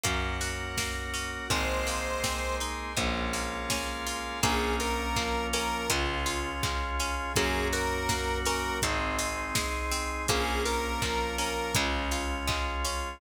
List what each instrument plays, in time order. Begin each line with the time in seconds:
0.04 electric bass (finger) F#2, acoustic guitar (steel) A#3, drawbar organ A#3 C#4 F#4 A#4 C#5 F#5, kick, closed hi-hat
0.41 acoustic guitar (steel) F#4, open hi-hat
0.77 acoustic guitar (steel) A#3, drawbar organ F#4 A#4 F#5, kick, snare
1.14 acoustic guitar (steel) C#4, open hi-hat
1.50 electric bass (finger) G#1, drawbar organ G#3 A#3 C4 D#4 G#4 A#4 C5 D#5, acoustic guitar (steel) G#3, lead 1 (square) C5, kick, closed hi-hat
1.87 acoustic guitar (steel) A#3, open hi-hat
2.23 acoustic guitar (steel) C4, drawbar organ G#4 A#4 D#5 G#5, kick, snare
2.60 acoustic guitar (steel) D#4, open hi-hat
2.96 electric bass (finger) A#1, acoustic guitar (steel) G#3, drawbar organ G#3 A#3 C#4 F4 G#4 A#4 C#5 F5, kick, closed hi-hat
3.33 acoustic guitar (steel) A#3, open hi-hat
3.70 acoustic guitar (steel) C#4, drawbar organ G#4 A#4 F5 G#5, kick, snare
4.07 acoustic guitar (steel) F4, open hi-hat
4.43 electric bass (finger) A#1, acoustic guitar (steel) A#3, drawbar organ A#3 C#4 F4, lead 1 (square) G#4, kick, closed hi-hat
4.80 acoustic guitar (steel) F4, lead 1 (square) A#4, open hi-hat
5.16 drawbar organ F3 A#3 F4, acoustic guitar (steel) A#3, kick, clap
5.53 acoustic guitar (steel) C#4, lead 1 (square) A#4, open hi-hat
5.89 electric bass (finger) C#2, drawbar organ G#3 C#4 F4, acoustic guitar (steel) G#3, kick, closed hi-hat
6.26 acoustic guitar (steel) F4, open hi-hat
6.62 drawbar organ G#3 F4 G#4, acoustic guitar (steel) G#3, kick, clap
7.00 acoustic guitar (steel) C#4, open hi-hat
7.36 electric bass (finger) F#2, drawbar organ A#3 C#4 F#4, acoustic guitar (steel) A#3, lead 1 (square) G#4, kick, closed hi-hat
7.73 acoustic guitar (steel) F#4, lead 1 (square) A#4, open hi-hat
8.09 drawbar organ F#3 A#3 F#4, acoustic guitar (steel) A#3, kick, snare
8.45 acoustic guitar (steel) C#4, lead 1 (square) A#4, open hi-hat
8.82 electric bass (finger) G#1, drawbar organ G#3 C4 D#4, acoustic guitar (steel) G#3, kick, closed hi-hat
9.19 acoustic guitar (steel) D#4, open hi-hat
9.55 drawbar organ G#3 D#4 G#4, acoustic guitar (steel) G#3, kick, snare
9.91 acoustic guitar (steel) C4, open hi-hat
10.28 electric bass (finger) A#1, drawbar organ A#3 C#4 F4, acoustic guitar (steel) A#3, lead 1 (square) G#4, kick, closed hi-hat
10.65 acoustic guitar (steel) F4, lead 1 (square) A#4, open hi-hat
11.02 drawbar organ F3 A#3 F4, acoustic guitar (steel) A#3, kick, clap
11.38 acoustic guitar (steel) C#4, lead 1 (square) A#4, open hi-hat
11.75 electric bass (finger) C#2, drawbar organ G#3 C#4 F4, acoustic guitar (steel) G#3, kick, closed hi-hat
12.11 acoustic guitar (steel) F4, open hi-hat
12.47 acoustic guitar (steel) G#3, drawbar organ G#3 F4 G#4, kick, clap
12.84 acoustic guitar (steel) C#4, open hi-hat